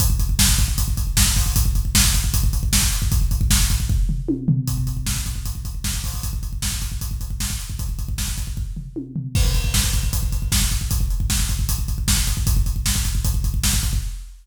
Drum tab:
CC |----------------|----------------|----------------|----------------|
HH |x-x---x-x-x---o-|x-x---x-x-x---x-|x-x---x---------|x-x---x-x-x---o-|
SD |----o-------o---|----o-------o---|----o-----------|----o-------o---|
T1 |----------------|----------------|------------o---|----------------|
FT |----------------|----------------|----------o---o-|----------------|
BD |oooooooooooooooo|oooooooooooooo-o|ooooooooo-------|oooooooooooooooo|

CC |----------------|----------------|x---------------|----------------|
HH |x-x---x-x-x---x-|x-x---x---------|--x---x-x-x---x-|x-x---x-x-x---x-|
SD |----o-------o---|----o-----------|----o-------o---|----o-------o---|
T1 |----------------|------------o---|----------------|----------------|
FT |----------------|----------o---o-|----------------|----------------|
BD |oooooooooooooo-o|ooooooooo-------|oooooooooooooooo|oo-ooooooooooooo|

CC |----------------|
HH |x-x---x-x-x---x-|
SD |----o-------o---|
T1 |----------------|
FT |----------------|
BD |oooooooooooooooo|